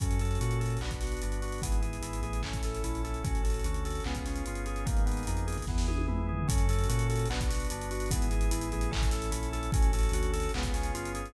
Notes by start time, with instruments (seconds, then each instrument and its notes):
0.00 synth bass 2 F#2, drawbar organ C#4 F#4 A4, kick, closed hi-hat
0.11 closed hi-hat
0.19 drawbar organ A4, closed hi-hat
0.25 closed hi-hat
0.31 closed hi-hat
0.35 closed hi-hat
0.41 synth bass 2 A#2, drawbar organ F#4, closed hi-hat
0.51 closed hi-hat
0.60 drawbar organ A4, closed hi-hat
0.66 closed hi-hat
0.70 closed hi-hat
0.77 closed hi-hat
0.81 synth bass 2 B1, drawbar organ B3 D4 F#4, clap
0.91 kick, closed hi-hat
1.01 drawbar organ F#4, snare, closed hi-hat
1.07 closed hi-hat
1.12 closed hi-hat
1.17 closed hi-hat
1.22 synth bass 2 G1, drawbar organ D4, closed hi-hat
1.32 closed hi-hat
1.42 drawbar organ F#4, closed hi-hat
1.48 closed hi-hat
1.52 closed hi-hat
1.58 synth bass 2 G#1, kick, closed hi-hat
1.62 drawbar organ B3 E4 G#4, closed hi-hat
1.72 closed hi-hat
1.82 drawbar organ G#4, closed hi-hat
1.93 closed hi-hat
2.01 synth bass 2 G#1, drawbar organ E4, closed hi-hat
2.13 closed hi-hat
2.23 synth bass 2 A1, drawbar organ G#4, closed hi-hat
2.33 closed hi-hat
2.43 drawbar organ C#4 E4 A4, kick, clap
2.53 kick, closed hi-hat
2.63 drawbar organ A4, snare, closed hi-hat
2.74 closed hi-hat
2.84 synth bass 2 A#1, drawbar organ E4, closed hi-hat
2.94 snare, closed hi-hat
3.04 drawbar organ A4, snare, closed hi-hat
3.14 closed hi-hat
3.24 synth bass 2 A1, drawbar organ C#4 F#4 A4, kick, closed hi-hat
3.35 closed hi-hat
3.44 drawbar organ A4, closed hi-hat
3.50 closed hi-hat
3.54 closed hi-hat
3.59 closed hi-hat
3.64 synth bass 2 D2, drawbar organ F#4, closed hi-hat
3.74 closed hi-hat
3.85 drawbar organ A4, closed hi-hat
3.90 closed hi-hat
3.95 closed hi-hat
4.00 closed hi-hat
4.04 synth bass 2 C#2, drawbar organ B3 C#4 F4 G#4, clap
4.15 kick, closed hi-hat
4.26 drawbar organ C#4, snare, closed hi-hat
4.36 closed hi-hat
4.46 synth bass 2 G1, drawbar organ F4, closed hi-hat
4.55 closed hi-hat
4.66 drawbar organ G#4, closed hi-hat
4.76 closed hi-hat
4.85 synth bass 2 G#1, drawbar organ A#3 B3 D#4 G#4, kick, closed hi-hat
4.97 closed hi-hat
5.06 drawbar organ B3, closed hi-hat
5.12 closed hi-hat
5.17 closed hi-hat
5.23 closed hi-hat
5.27 synth bass 2 F2, drawbar organ D#4, closed hi-hat
5.37 closed hi-hat
5.47 drawbar organ G#4, closed hi-hat
5.52 closed hi-hat
5.58 kick, closed hi-hat
5.62 closed hi-hat
5.67 synth bass 2 E2, drawbar organ B3 E4 G#4, kick, snare
5.78 snare
5.88 drawbar organ G#4, high tom
5.98 high tom
6.08 synth bass 2 F2, drawbar organ E4, mid tom
6.17 mid tom
6.29 drawbar organ G#4, floor tom
6.39 floor tom
6.48 synth bass 2 F#2, drawbar organ C#4 F#4 A4, kick, closed hi-hat
6.58 closed hi-hat
6.69 drawbar organ A4, closed hi-hat
6.73 closed hi-hat
6.79 closed hi-hat
6.84 closed hi-hat
6.89 synth bass 2 A#2, drawbar organ F#4, closed hi-hat
6.99 closed hi-hat
7.10 drawbar organ A4, closed hi-hat
7.16 closed hi-hat
7.19 closed hi-hat
7.26 closed hi-hat
7.30 synth bass 2 B1, drawbar organ B3 D4 F#4, clap
7.41 kick, closed hi-hat
7.49 drawbar organ F#4, snare, closed hi-hat
7.55 closed hi-hat
7.60 closed hi-hat
7.65 closed hi-hat
7.70 synth bass 2 G1, drawbar organ D4, closed hi-hat
7.81 closed hi-hat
7.91 drawbar organ F#4, closed hi-hat
7.95 closed hi-hat
8.00 closed hi-hat
8.06 closed hi-hat
8.11 synth bass 2 G#1, drawbar organ B3 E4 G#4, kick, closed hi-hat
8.22 closed hi-hat
8.31 drawbar organ G#4, closed hi-hat
8.41 closed hi-hat
8.51 synth bass 2 G#1, drawbar organ E4, closed hi-hat
8.61 closed hi-hat
8.72 synth bass 2 A1, drawbar organ G#4, closed hi-hat
8.81 closed hi-hat
8.91 drawbar organ C#4 E4 A4, kick, clap
9.02 kick, closed hi-hat
9.11 drawbar organ A4, snare, closed hi-hat
9.22 closed hi-hat
9.31 synth bass 2 A#1, drawbar organ E4, closed hi-hat
9.42 snare, closed hi-hat
9.53 drawbar organ A4, snare, closed hi-hat
9.63 closed hi-hat
9.72 synth bass 2 A1, drawbar organ C#4 F#4 A4, kick, closed hi-hat
9.82 closed hi-hat
9.93 drawbar organ A4, closed hi-hat
9.99 closed hi-hat
10.03 closed hi-hat
10.09 synth bass 2 D2, closed hi-hat
10.13 drawbar organ F#4, closed hi-hat
10.23 closed hi-hat
10.33 drawbar organ A4, closed hi-hat
10.40 closed hi-hat
10.43 closed hi-hat
10.49 closed hi-hat
10.54 synth bass 2 C#2, drawbar organ B3 C#4 F4 G#4, clap
10.63 kick, closed hi-hat
10.74 drawbar organ C#4, snare, closed hi-hat
10.83 closed hi-hat
10.94 synth bass 2 G1, drawbar organ F4, closed hi-hat
11.05 closed hi-hat
11.15 drawbar organ G#4, closed hi-hat
11.26 closed hi-hat